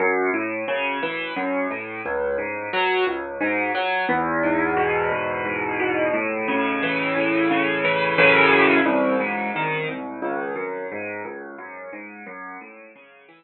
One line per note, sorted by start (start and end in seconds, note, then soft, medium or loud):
0.00 0.30 F#2 loud
0.34 0.64 A2 medium
0.68 0.99 C#3 medium
1.03 1.33 E3 medium
1.37 1.67 F#2 medium
1.70 2.01 A2 medium
2.06 2.36 C#2 medium
2.38 2.69 G#2 medium
2.73 3.04 F#3 medium
3.07 3.37 C#2 medium
3.41 3.71 G#2 medium
3.75 4.05 F#3 medium
4.09 5.11 E2 loud
4.43 5.45 G#2 medium
4.77 5.79 B2 medium
5.12 6.09 E2 medium
5.45 6.10 G#2 medium
5.80 6.12 B2 medium
6.13 7.15 A2 medium
6.48 7.50 C#3 medium
6.83 7.84 E3 medium
7.16 8.13 A2 medium
7.51 8.15 C#3 medium
7.85 8.17 E3 medium
8.18 8.80 F#2 loud
8.18 8.80 A2 medium
8.18 8.80 C#3 loud
8.18 8.80 E3 medium
8.85 9.16 C2 loud
9.20 9.50 G#2 medium
9.56 9.86 D#3 medium
9.88 10.19 C2 medium
10.22 10.53 C#2 medium
10.56 10.86 F#2 medium
10.92 11.22 G#2 medium
11.25 11.56 C#2 medium
11.58 11.89 F#2 medium
11.93 12.23 G#2 medium
12.26 12.57 F#2 loud
12.61 12.92 A2 medium
12.96 13.26 C#3 medium
13.29 13.44 E3 medium